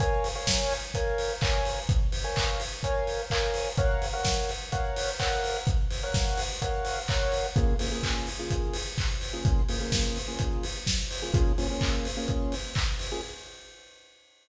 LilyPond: <<
  \new Staff \with { instrumentName = "Lead 2 (sawtooth)" } { \time 4/4 \key bes \minor \tempo 4 = 127 <bes' des'' f'' aes''>8. <bes' des'' f'' aes''>4~ <bes' des'' f'' aes''>16 <bes' des'' f'' aes''>4 <bes' des'' f'' aes''>4~ | <bes' des'' f'' aes''>8. <bes' des'' f'' aes''>4~ <bes' des'' f'' aes''>16 <bes' des'' f'' aes''>4 <bes' des'' f'' aes''>4 | <bes' des'' f'' ges''>8. <bes' des'' f'' ges''>4~ <bes' des'' f'' ges''>16 <bes' des'' f'' ges''>4 <bes' des'' f'' ges''>4~ | <bes' des'' f'' ges''>8. <bes' des'' f'' ges''>4~ <bes' des'' f'' ges''>16 <bes' des'' f'' ges''>4 <bes' des'' f'' ges''>4 |
<des bes f' aes'>8 <des bes f' aes'>16 <des bes f' aes'>4 <des bes f' aes'>2 <des bes f' aes'>16~ | <des bes f' aes'>8 <des bes f' aes'>16 <des bes f' aes'>4 <des bes f' aes'>2 <des bes f' aes'>16 | <bes des' f' aes'>8 <bes des' f' aes'>16 <bes des' f' aes'>4 <bes des' f' aes'>2 <bes des' f' aes'>16 | }
  \new DrumStaff \with { instrumentName = "Drums" } \drummode { \time 4/4 <hh bd>8 hho8 <bd sn>8 hho8 <hh bd>8 hho8 <hc bd>8 hho8 | <hh bd>8 hho8 <hc bd>8 hho8 <hh bd>8 hho8 <hc bd>8 hho8 | <hh bd>8 hho8 <bd sn>8 hho8 <hh bd>8 hho8 <hc bd>8 hho8 | <hh bd>8 hho8 <bd sn>8 hho8 <hh bd>8 hho8 <hc bd>8 hho8 |
<hh bd>8 hho8 <hc bd>8 hho8 <hh bd>8 hho8 <hc bd>8 hho8 | <hh bd>8 hho8 <bd sn>8 hho8 <hh bd>8 hho8 <bd sn>8 hho8 | <hh bd>8 hho8 <hc bd>8 hho8 <hh bd>8 hho8 <hc bd>8 hho8 | }
>>